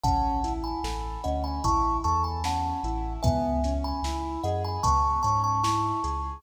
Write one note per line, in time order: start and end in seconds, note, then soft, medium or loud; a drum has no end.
0.04 0.72 A1 loud
0.04 0.41 C#4 medium
0.04 0.53 F#5 loud
0.04 0.53 A5 loud
0.04 kick loud
0.04 closed hi-hat loud
0.44 0.80 E4 medium
0.44 snare medium
0.44 closed hi-hat medium
0.64 1.23 G#5 medium
0.64 1.23 B5 medium
0.84 1.18 A1 medium
0.84 1.20 A4 medium
0.84 snare loud
1.24 1.60 D2 loud
1.24 1.61 C#4 medium
1.24 1.43 D#5 medium
1.24 1.43 F#5 medium
1.24 closed hi-hat medium
1.44 1.63 G#5 medium
1.44 1.63 B5 medium
1.64 1.99 A1 loud
1.64 2.00 E4 medium
1.64 1.97 A5 medium
1.64 1.97 C#6 loud
1.64 kick loud
1.64 closed hi-hat loud
2.04 2.73 E2 loud
2.04 2.40 A4 medium
2.04 2.23 A5 medium
2.04 2.23 C#6 medium
2.04 closed hi-hat medium
2.24 2.43 G#5 medium
2.24 2.43 B5 medium
2.44 2.80 C#4 medium
2.44 3.13 F#5 medium
2.44 3.13 A5 medium
2.44 snare loud
2.83 3.18 A1 loud
2.83 3.21 E4 medium
2.83 closed hi-hat medium
3.23 3.93 C#2 loud
3.23 3.60 B3 medium
3.23 3.74 E5 medium
3.23 3.74 G#5 loud
3.23 kick loud
3.23 closed hi-hat loud
3.64 4.01 C#4 medium
3.64 snare medium
3.64 closed hi-hat medium
3.84 4.39 G#5 medium
3.84 4.39 B5 loud
4.03 4.37 C#2 medium
4.03 4.41 E4 medium
4.03 snare loud
4.44 4.78 F#2 loud
4.44 4.81 G#4 medium
4.44 4.62 D#5 medium
4.44 4.62 F#5 medium
4.44 closed hi-hat medium
4.65 4.83 G#5 medium
4.65 4.83 B5 medium
4.83 5.19 C#2 medium
4.83 5.20 B3 medium
4.83 5.22 A5 loud
4.83 5.22 C#6 loud
4.83 kick loud
4.83 closed hi-hat loud
5.23 5.92 G#2 loud
5.23 5.60 C#4 medium
5.23 5.42 A5 loud
5.23 5.42 C#6 loud
5.23 closed hi-hat medium
5.44 5.63 A5 medium
5.44 5.63 C#6 medium
5.64 6.00 E4 medium
5.64 6.40 A5 medium
5.64 6.40 C#6 medium
5.64 snare loud
6.04 6.38 C#2 medium
6.04 6.40 G#4 medium
6.04 snare soft
6.04 closed hi-hat medium